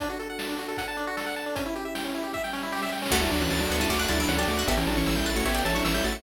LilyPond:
<<
  \new Staff \with { instrumentName = "Lead 1 (square)" } { \time 4/4 \key d \major \tempo 4 = 154 r1 | r1 | <a fis'>16 <g e'>16 <fis d'>16 <e cis'>16 <e cis'>16 <fis d'>8 <g e'>16 <a fis'>8 <g e'>16 <fis d'>16 <e cis'>16 <fis d'>16 <a fis'>8 | <b g'>16 <e cis'>16 <fis d'>16 <e cis'>16 <e cis'>16 <g e'>8 <a fis'>16 <b g'>8 <e cis'>16 <fis d'>16 <e cis'>16 <g e'>16 <a fis'>8 | }
  \new Staff \with { instrumentName = "Harpsichord" } { \time 4/4 \key d \major r1 | r1 | <fis a>4. b16 cis'16 cis'16 d'16 fis'16 e'8 g'16 r16 fis'16 | <fis' a'>4. b'16 cis''16 cis''16 d''16 e''16 e''8 e''16 r16 e''16 | }
  \new Staff \with { instrumentName = "Lead 1 (square)" } { \time 4/4 \key d \major d'16 fis'16 a'16 fis''16 a''16 d'16 fis'16 a'16 fis''16 a''16 d'16 fis'16 a'16 fis''16 a''16 d'16 | cis'16 e'16 g'16 e''16 g''16 cis'16 e'16 g'16 e''16 g''16 cis'16 e'16 g'16 e''16 g''16 cis'16 | fis''16 a''16 d'''16 fis'''16 a'''16 d''''16 fis''16 a''16 d'''16 fis'''16 a'''16 d''''16 fis''16 a''16 d'''16 fis'''16 | e''16 g''16 a''16 cis'''16 e'''16 g'''16 a'''16 cis''''16 e''16 g''16 a''16 cis'''16 e'''16 g'''16 a'''16 cis''''16 | }
  \new Staff \with { instrumentName = "Synth Bass 1" } { \clef bass \time 4/4 \key d \major r1 | r1 | d,8 d,8 d,8 d,8 d,8 d,8 d,8 d,8 | a,,8 a,,8 a,,8 a,,8 a,,8 a,,8 a,,8 a,,8 | }
  \new Staff \with { instrumentName = "Pad 2 (warm)" } { \time 4/4 \key d \major <d' fis' a'>2 <d' a' d''>2 | <cis' e' g'>2 <g cis' g'>2 | <d' fis' a'>2 <d' a' d''>2 | <cis' e' g' a'>2 <cis' e' a' cis''>2 | }
  \new DrumStaff \with { instrumentName = "Drums" } \drummode { \time 4/4 <hh bd>8 hh8 sn8 hh8 <hh bd>8 hh8 sn8 hh8 | <hh bd>8 hh8 sn8 hh8 <bd sn>16 sn16 sn16 sn16 sn32 sn32 sn32 sn32 sn32 sn32 sn32 sn32 | <cymc bd>16 cymr16 cymr16 cymr16 sn16 cymr16 cymr16 <bd cymr>16 <bd cymr>16 cymr16 cymr16 cymr16 sn16 cymr16 cymr16 cymr16 | <bd cymr>16 cymr16 cymr16 cymr16 sn16 <bd cymr>16 cymr16 cymr16 <bd cymr>16 cymr16 cymr16 cymr16 sn16 cymr16 cymr16 cymr16 | }
>>